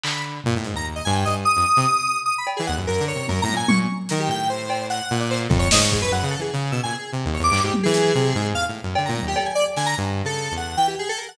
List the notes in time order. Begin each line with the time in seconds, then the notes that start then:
0.03 D3 B5, clap
0.44 A#2, floor tom
0.56 A2
0.64 G#2, closed hi-hat
0.74 D#2 A#5
0.96 D#5
1.05 G2 G#5
1.15 G5
1.25 G2 D#5
1.45 D#6
1.56 F2
1.77 C3
2.26 D#6
2.38 B5
2.47 cowbell
2.57 E3 G#4
2.67 D#2 F#5
2.77 F#2
2.87 F#2 A#4
3.00 D3
3.08 C#5
3.15 C3
3.28 F#2 A#4, high tom
3.42 A2 A#5
3.48 high tom
3.53 A#2 G#5
3.68 A#2 C#6, high tom
4.09 D#3 A#4, closed hi-hat
4.20 G4
4.28 A2 G5
4.49 C5
4.70 cowbell
4.90 F#5, closed hi-hat
5.11 A#2
5.20 D5
5.30 C5, clap
5.49 F2 A4, kick
5.59 C#5
5.71 G#2 D#5, snare
5.82 C#6
5.91 G#4, kick
6.01 F#2 B4
6.11 F#2 F#5
6.23 C#3
6.31 A4
6.39 E3 G#4
6.53 C#3
6.71 B2 E6
6.83 A#2 G#5
6.92 G#4
7.12 C3
7.25 D#2
7.34 C#5
7.39 E2
7.44 D6
7.51 G2, clap
7.64 G#2 G4
7.74 high tom
7.83 E3 G#4
7.94 closed hi-hat
8.15 C3
8.35 G#2
8.54 E2 F5
8.68 A2
8.83 F#2
8.95 D3, cowbell
9.05 A#2 A#5
9.16 high tom
9.22 D#2
9.28 G4
9.36 A4, cowbell
9.46 G#5
9.55 D5
9.76 D3 G#5, snare
9.86 A#5
9.98 G2
10.24 C#3 A4
10.51 E2
10.57 F#5
10.77 E3 G5
10.88 G4
10.99 G#4
11.09 A4
11.18 A#4
11.28 F#5